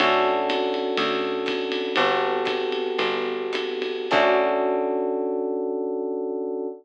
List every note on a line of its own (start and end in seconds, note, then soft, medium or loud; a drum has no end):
0.00 0.90 D2 loud
0.00 1.93 C#4 medium
0.00 1.93 D4 medium
0.00 1.93 F#4 medium
0.00 1.93 A4 loud
0.00 ride loud
0.49 hi-hat pedal medium
0.49 ride loud
0.74 ride medium
0.97 1.88 D2 medium
0.97 ride loud
1.46 kick medium
1.46 hi-hat pedal medium
1.46 ride loud
1.72 ride medium
1.96 2.91 G1 loud
1.96 4.07 B3 medium
1.96 4.07 F#4 medium
1.96 4.07 G4 medium
1.96 4.07 A4 medium
1.96 ride loud
2.45 kick medium
2.45 hi-hat pedal medium
2.45 ride loud
2.72 ride medium
2.98 4.01 G1 medium
2.98 ride loud
3.53 hi-hat pedal loud
3.53 ride loud
3.82 ride medium
4.11 6.68 D2 loud
4.11 6.67 C#4 loud
4.11 6.67 D4 loud
4.11 6.67 F#4 medium
4.11 6.67 A4 loud
4.11 kick loud
4.11 crash loud